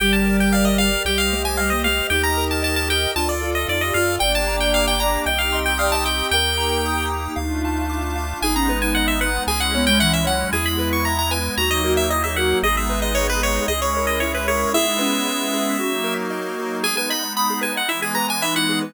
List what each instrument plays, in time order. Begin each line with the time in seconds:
0.00 synth bass 1 G1, ocarina G3, lead 1 (square) G4 G5, pad 5 (bowed) A#4 D5 G5
0.13 lead 1 (square) A5
0.25 lead 1 (square) A#4
0.40 lead 1 (square) G5
0.53 lead 1 (square) D5 F5
0.65 lead 1 (square) D#5
0.78 lead 1 (square) G4 F5
1.05 synth bass 1 C2, ocarina G3, lead 1 (square) G4 G5, pad 5 (bowed) C5 D#5 G5
1.18 lead 1 (square) F5
1.32 ocarina A3, lead 1 (square) C5
1.45 lead 1 (square) G#5
1.57 ocarina G3, lead 1 (square) D#5 F5
1.70 ocarina A#3, lead 1 (square) D#5
1.84 ocarina A3, lead 1 (square) G4 F5
2.10 synth bass 1 D#2, ocarina D#4, lead 1 (square) G4 G5, pad 5 (bowed) A#4 D#5 G5
2.23 lead 1 (square) A#5
2.37 lead 1 (square) A#4
2.51 lead 1 (square) A5
2.62 lead 1 (square) D#5 A5
2.76 lead 1 (square) A5
2.88 lead 1 (square) G4 G5
3.15 synth bass 1 D2, ocarina D4, lead 1 (square) F4 A5, pad 5 (bowed) A4 D5 F5
3.29 lead 1 (square) D5
3.41 ocarina F4, lead 1 (square) A4
3.55 lead 1 (square) D#5
3.67 synth bass 1 F2, ocarina D#4, lead 1 (square) D5
3.81 ocarina G4, lead 1 (square) D#5
3.94 synth bass 1 F#2, ocarina F4, lead 1 (square) F4 F5
4.19 synth bass 1 G1, pad 5 (bowed) A#3 D4 G4, ocarina D5, lead 1 (square) G5
4.35 lead 1 (square) A5
4.47 lead 1 (square) A#5
4.60 lead 1 (square) G5
4.74 lead 1 (square) F5 D6
4.88 lead 1 (square) G5
5.00 lead 1 (square) G5 A#5
5.26 synth bass 1 C2, pad 5 (bowed) C4 D#4 G4, ocarina D#5, lead 1 (square) G5
5.38 lead 1 (square) F5
5.53 ocarina D#5, lead 1 (square) C6
5.66 lead 1 (square) G5
5.78 ocarina D5, lead 1 (square) F5 D#6
5.92 ocarina D#5, lead 1 (square) A5
6.06 ocarina D#5, lead 1 (square) G5
6.31 synth bass 1 D#2, pad 5 (bowed) A#3 D#4 G4, ocarina A#4, lead 1 (square) G5
6.58 lead 1 (square) A#5
6.83 ocarina D#4, lead 1 (square) D#6
7.10 lead 1 (square) G5
7.36 synth bass 1 D2, pad 5 (bowed) A3 D4 F4, lead 1 (square) F5
7.65 lead 1 (square) A5
7.89 lead 1 (square) D6
8.16 lead 1 (square) F5
8.42 synth bass 1 G#1, pad 5 (bowed) G#3 B3 D#4, ocarina D#4, lead 1 (square) G#4 G#5
8.55 ocarina C#4, lead 1 (square) A#5
8.69 ocarina B3, lead 1 (square) B4
8.82 ocarina D#4, lead 1 (square) G#5
8.95 lead 1 (square) D#5 F#5
9.08 lead 1 (square) E5
9.21 lead 1 (square) B4 F#5
9.47 synth bass 1 C#2, pad 5 (bowed) G#3 C#4 E4, lead 1 (square) G#4 G#5
9.60 lead 1 (square) F#5
9.74 ocarina B3, lead 1 (square) C#5
9.87 ocarina G#3, lead 1 (square) G5
9.99 ocarina E3, lead 1 (square) E5 F#5
10.13 lead 1 (square) E5
10.24 ocarina F#3, lead 1 (square) C#5 F#5
10.52 synth bass 1 E2, pad 5 (bowed) G#3 B3 E4, ocarina E4, lead 1 (square) G#4 G#5
10.66 lead 1 (square) B5
10.79 lead 1 (square) B4
10.93 lead 1 (square) C#6
11.05 lead 1 (square) E5 A#5
11.19 lead 1 (square) A#5
11.31 lead 1 (square) B4 G#5
11.57 synth bass 1 D#2, pad 5 (bowed) F#3 A#3 D#4, ocarina D#4, lead 1 (square) F#4 A#5
11.71 lead 1 (square) D#5
11.84 ocarina F#4, lead 1 (square) A#4
11.97 lead 1 (square) E5
12.10 ocarina E4, lead 1 (square) D#5
12.24 ocarina G#4, lead 1 (square) E5
12.36 ocarina F#4, lead 1 (square) A#4 F#5
12.62 synth bass 1 G#1, pad 5 (bowed) G#3 B3 D#4, ocarina G#4, lead 1 (square) G#4 D#5
12.77 lead 1 (square) E5
12.89 lead 1 (square) B4
13.02 lead 1 (square) D#5
13.15 lead 1 (square) C#5 D#5
13.29 lead 1 (square) B4
13.41 lead 1 (square) G#4 C#5
13.68 synth bass 1 C#2, pad 5 (bowed) G#3 C#4 E4, ocarina G#4, lead 1 (square) G#4 D#5
13.82 lead 1 (square) C#5
13.94 ocarina A#4, lead 1 (square) C#5
14.07 lead 1 (square) D#5
14.20 ocarina E4, lead 1 (square) C#5 E5
14.34 lead 1 (square) B4, ocarina C#5
14.47 lead 1 (square) G#4 C#5, ocarina A#4
14.73 pad 5 (bowed) G#3 B3 E4, ocarina E4, lead 1 (square) G#4 E5
14.87 ocarina D#4
14.99 ocarina C#4, lead 1 (square) B4
15.26 lead 1 (square) E5
15.54 lead 1 (square) G#4
15.80 pad 5 (bowed) F#3 A#3 D#4, lead 1 (square) F#4
16.04 lead 1 (square) A#4
16.30 lead 1 (square) D#5
16.59 lead 1 (square) F#4
16.83 pad 5 (bowed) G#3 B3 D#4, lead 1 (square) G#4 G#5
16.97 lead 1 (square) B4 G#5
17.10 lead 1 (square) D#5 B5
17.22 lead 1 (square) B5
17.37 lead 1 (square) B5 D#6
17.50 lead 1 (square) G#4
17.61 lead 1 (square) B4 G#5
17.76 lead 1 (square) D#5 F#5
17.88 pad 5 (bowed) E3 G#3 B3, lead 1 (square) E4 E5
18.02 lead 1 (square) G#4 G#5
18.15 lead 1 (square) B4 A#5
18.28 lead 1 (square) G#5
18.42 ocarina D#4, lead 1 (square) E5 B5
18.55 lead 1 (square) E4 F#5
18.69 lead 1 (square) G#4
18.82 lead 1 (square) B4